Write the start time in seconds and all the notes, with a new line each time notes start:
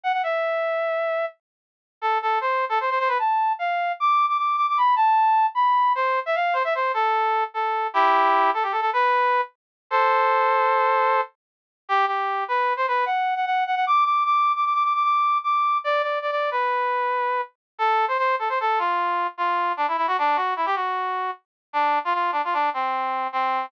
0.03 F#5
0.13 F#5
0.23 E5
2.01 A4
2.22 A4
2.41 C5
2.69 A4
2.81 C5
2.90 C5
2.99 C5
3.08 B4
3.19 A5
3.59 F5
4.00 D6
4.28 D6
4.38 D6
4.57 D6
4.69 D6
4.77 B5
4.96 A5
5.55 B5
5.95 C5
6.26 E5
6.35 F5
6.53 C5
6.64 E5
6.75 C5
6.94 A4
7.54 A4
7.94 E4 G4
8.54 A4
8.63 G4
8.72 A4
8.81 A4
8.93 B4
9.90 A4 C5
11.89 G4
12.07 G4
12.48 B4
12.77 C5
12.88 B4
13.06 F#5
13.36 F#5
13.46 F#5
13.66 F#5
13.75 F#5
13.87 D6
14.05 D6
14.25 D6
14.56 D6
14.65 D6
14.74 D6
14.84 D6
14.95 D6
15.04 D6
15.44 D6
15.84 D5
16.02 D5
16.22 D5
16.31 D5
16.51 B4
17.78 A4
18.08 C5
18.18 C5
18.39 A4
18.49 C5
18.60 A4
18.79 F4
19.38 F4
19.77 D4
19.88 E4
19.97 E4
20.07 F#4
20.18 D4
20.36 F#4
20.56 E4
20.66 G4
20.75 F#4
21.73 D4
22.05 F4
22.14 F4
22.32 D4
22.44 F4
22.53 D4
22.74 C4
23.32 C4